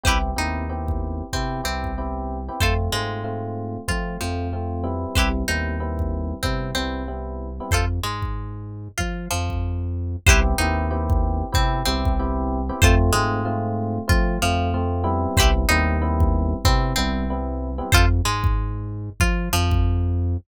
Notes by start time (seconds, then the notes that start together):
0.04 C2 B3 C4 E4 G4 B4 C5, kick
0.08 E4
0.36 D#2 B3 C4 D#4 E4 G4
0.69 B3 C4 E4 G4
0.88 kick
1.33 C3 B3 C4 E4 G4, kick
1.64 C2 B3 C4 E4 G4
1.84 kick
1.98 B3 C4 E4 G4
2.49 B3 C4 E4 G4
2.61 F2 A3 C4 F4 A4 C5, kick
2.92 G#2 G#3 A3 C4 F4
3.24 A3 C4 F4
3.88 F3 A3 C4 F4, kick
4.21 F2 F3 A3 C4 F4
4.53 A3 C4 F4
4.84 G3 B3 C4 E4
5.15 C2 E4 G4 B4 C5, kick
5.48 D#2 G3 B3 C4 D#4 E4
5.80 G3 B3 C4 E4
5.99 kick
6.43 C3 G3 B3 C4 E4, kick
6.75 C2 G3 B3 C4 E4
7.08 G3 B3 C4 E4
7.60 G3 B3 C4 E4
7.71 F2 F4 A4 C5, kick
8.03 G#2 G#3
8.22 kick
8.98 F3 F4, kick
9.31 F2 F3
9.50 kick
10.27 C2 B3 C4 E4 G4 B4 C5, kick
10.58 D#2 B3 C4 D#4 E4 G4
10.91 B3 C4 E4 G4
11.10 kick
11.52 C3 B3 C4 E4 G4, kick
11.86 C2 B3 C4 E4 G4
12.05 kick
12.19 B3 C4 E4 G4
12.69 B3 C4 E4 G4
12.82 F2 A3 C4 F4 A4 C5, kick
13.13 G#2 G#3 A3 C4 F4
13.45 A3 C4 F4
14.08 F3 A3 C4 F4, kick
14.42 F2 F3 A3 C4 F4
14.74 A3 C4 F4
15.04 G3 B3 C4 E4
15.37 C2 E4 G4 B4 C5, kick
15.69 D#2 G3 B3 C4 D#4 E4
16.02 G3 B3 C4 E4
16.20 kick
16.65 C3 G3 B3 C4 E4, kick
16.96 C2 G3 B3 C4 E4
17.30 G3 B3 C4 E4
17.78 G3 B3 C4 E4
17.92 F2 F4 A4 C5, kick
18.25 G#2 G#3
18.44 kick
19.20 F3 F4, kick
19.53 F2 F3
19.71 kick